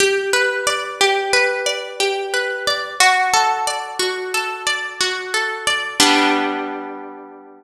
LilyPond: \new Staff { \time 9/8 \key g \major \tempo 4. = 60 g'8 b'8 d''8 g'8 b'8 d''8 g'8 b'8 d''8 | fis'8 a'8 d''8 fis'8 a'8 d''8 fis'8 a'8 d''8 | <g b d'>1~ <g b d'>8 | }